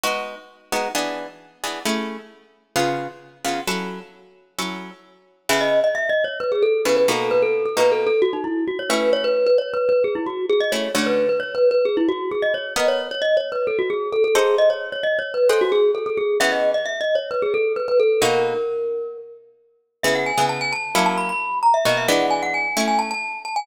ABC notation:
X:1
M:4/4
L:1/16
Q:1/4=132
K:C#m
V:1 name="Glockenspiel"
z16 | z16 | z16 | e d2 d (3e2 d2 c2 B G A2 B B A2 |
B A2 A (3B2 A2 A2 F D E2 F c B2 | c B2 B (3c2 B2 B2 G E F2 G d c2 | c B2 B (3c2 B2 B2 G E F2 G d c2 | d c2 c (3d2 c2 B2 A F G2 A A G2 |
d c2 c (3d2 c2 B2 A F G2 A A G2 | e d2 d (3e2 d2 c2 B G A2 B B A2 | ^A10 z6 | e f g2 a g a3 a b b3 ^a e |
d e f2 g f g3 g a a3 a g |]
V:2 name="Acoustic Guitar (steel)"
[G,B,DF]6 [G,B,DF]2 [E,B,=DG]6 [E,B,DG]2 | [A,CEG]8 [C,B,^EG]6 [C,B,EG]2 | [F,CEA]8 [F,CEA]8 | [C,B,EG]12 [C,B,EG]2 [B,,^A,DF]2- |
[B,,^A,DF]4 [B,,A,DF]10 [=A,CE]2- | [A,CE]14 [A,CE]2 | [=D,A,CF]16 | [B,^Adf]14 [D=A=cf]2- |
[DA=cf]8 [G^Bdf]8 | [E,B,CG]16 | [B,,^A,DF]16 | [C,B,EG]3 [C,B,EG]5 [F,^A,CE]8 |
[B,,^A,DF]2 [E,G,B,=D]6 [=A,CE]8 |]